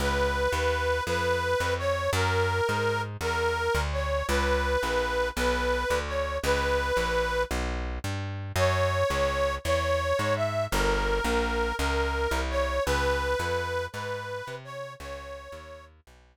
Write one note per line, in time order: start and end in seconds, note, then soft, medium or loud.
0.00 0.48 C#2 medium
0.00 1.03 B4 medium
0.52 1.01 D#2 medium
1.07 1.55 F2 medium
1.07 1.74 B4 medium
1.60 2.09 F2 medium
1.78 2.10 C#5 medium
2.13 2.61 F#2 loud
2.13 3.02 A#4 medium
2.69 3.17 G#2 medium
3.21 3.69 E2 medium
3.21 3.81 A#4 medium
3.75 4.23 D2 medium
3.93 4.26 C#5 medium
4.28 4.77 C#2 medium
4.28 5.29 B4 medium
4.83 5.31 A#1 medium
5.36 5.85 B1 medium
5.36 5.99 B4 medium
5.90 6.39 D2 medium
6.07 6.38 C#5 medium
6.43 6.92 C#2 medium
6.43 7.43 B4 medium
6.97 7.45 A#1 medium
7.51 7.99 B1 medium
8.04 8.52 G2 medium
8.56 9.04 F#2 medium
8.56 9.55 C#5 medium
9.10 9.58 C#2 medium
9.64 10.13 E2 medium
9.64 10.34 C#5 medium
10.19 10.67 G#2 medium
10.36 10.65 E5 medium
10.71 11.21 G1 medium
10.71 11.75 A#4 medium
11.24 11.73 A#1 medium
11.79 12.27 C#2 medium
11.79 12.40 A#4 medium
12.31 12.79 C2 medium
12.50 12.84 C#5 medium
12.86 13.35 C#2 medium
12.86 13.86 B4 medium
13.39 13.88 F2 medium
13.93 14.42 G#2 medium
13.93 14.55 B4 medium
14.47 14.96 C3 medium
14.64 14.93 C#5 medium
15.00 15.48 C#2 medium
15.00 15.85 C#5 medium
15.52 16.01 D#2 medium
16.07 16.37 B1 medium